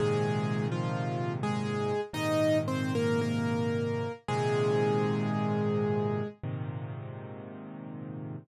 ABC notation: X:1
M:4/4
L:1/16
Q:1/4=56
K:Ab
V:1 name="Acoustic Grand Piano"
(3[A,A]4 [F,F]4 [A,A]4 [Ee]2 [Cc] [B,B] [B,B]4 | [A,A]8 z8 |]
V:2 name="Acoustic Grand Piano" clef=bass
[A,,B,,C,E,]8 [A,,B,,C,E,]8 | [A,,B,,C,E,]8 [A,,B,,C,E,]8 |]